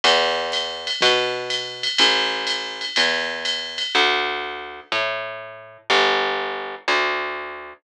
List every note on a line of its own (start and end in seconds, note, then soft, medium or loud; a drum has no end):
0.04 0.90 E2 loud
0.04 ride loud
0.52 hi-hat pedal medium
0.52 ride medium
0.87 ride medium
1.01 1.88 B2 loud
1.01 kick medium
1.01 ride loud
1.50 hi-hat pedal medium
1.50 ride medium
1.83 ride medium
1.98 2.85 A1 medium
1.98 ride loud
2.47 hi-hat pedal medium
2.47 ride medium
2.81 ride medium
2.96 3.83 E2 medium
2.96 ride loud
3.45 hi-hat pedal medium
3.45 ride medium
3.78 ride medium
3.95 4.80 D2 loud
4.92 5.78 A2 medium
5.90 6.75 G1 loud
6.88 7.73 D2 loud